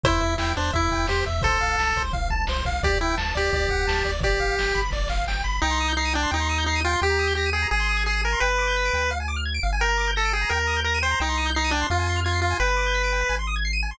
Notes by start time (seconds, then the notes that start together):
0.03 E2 E4 C5, kick, floor tom
0.20 E2 E5, floor tom
0.38 E2 E4 G5, snare
0.55 E2 D4 C5, floor tom
0.73 E2 E4 E5, kick, floor tom
0.91 E2 G5, kick, floor tom
1.07 E2 G4 C5, snare
1.25 E2 E5, kick, snare, floor tom
1.41 C2 A4 C5, kick, floor tom
1.61 C2 F5, floor tom
1.78 C2 A5, snare
1.96 C2 C5, kick, floor tom
2.13 C2 F5, kick, floor tom
2.30 C2 A5, kick, floor tom
2.47 C2 C5, snare
2.65 C2 F5, kick, snare, floor tom
2.83 D2 G4 D5, kick, floor tom
3.01 D2 E4 G5, floor tom
3.17 D2 A5, snare
3.35 D2 G4 D5, floor tom
3.53 D2 D5, kick, floor tom
3.68 D2 F#5, kick, floor tom
3.87 D2 A5, snare
4.04 D2 D5, kick, snare, floor tom
4.21 G1 G4 D5, kick, floor tom
4.40 G1 F5, floor tom
4.57 G1 G5, snare
4.74 G1 B5, kick, floor tom
4.90 G1 D5, kick, snare
5.08 G1 F5, snare
5.27 G1 G5, snare
5.44 G1 B5
5.62 C2 D#4 G5
5.71 C6
5.80 D#6
5.88 G6
5.97 D#4 C7
6.05 D#7
6.14 D4 G5
6.23 C6
6.31 D#2 D#4 G5
6.40 C6
6.49 D#6
6.58 G6
6.66 D#4 C7
6.76 D#7
6.84 F4 G5
6.93 C6
7.02 D#2 G4 G5
7.10 A#5
7.19 D#6
7.27 G6
7.35 G4 A#6
7.46 D#7
7.53 G#4 G5
7.62 A#5
7.71 G#1 G#4 G#5
7.80 C6
7.89 D#6
7.97 G#6
8.06 G#4 C7
8.15 D#7
8.23 A#4 G#5
8.32 C6
8.40 G1 B4 G5
8.50 B5
8.58 D6
8.67 G6
8.77 B6
8.85 D7
8.93 D2 G5
9.02 B5
9.11 F5
9.20 G#5
9.28 D6
9.36 F6
9.45 G#6
9.54 D7
9.63 G1 F5
9.73 G#5
9.80 A#4 G5
9.89 A#5
9.98 D6
10.07 G6
10.16 A4 A#6
10.25 D7
10.33 G#4 G5
10.41 A#5
10.49 D#2 A#4 G5
10.59 A#5
10.67 D#6
10.77 G6
10.84 A#4 A#6
10.94 D#7
11.02 C5 G5
11.11 A#5
11.20 C2 D#4 G5
11.29 C6
11.37 D#6
11.46 G6
11.55 D#4 C7
11.64 D#7
11.71 D4 G5
11.81 C6
11.90 F2 F4 F5
11.99 G#5
12.07 C6
12.16 F6
12.24 F4 G#6
12.33 C7
12.42 F4 F5
12.51 G#5
12.60 G1 B4 G5
12.69 B5
12.77 D6
12.86 G6
12.94 B6
13.04 D7
13.12 G5
13.21 B5
13.29 G#1 G#5
13.39 C6
13.47 D#6
13.56 G#6
13.65 C7
13.73 D#7
13.83 G#5
13.91 C6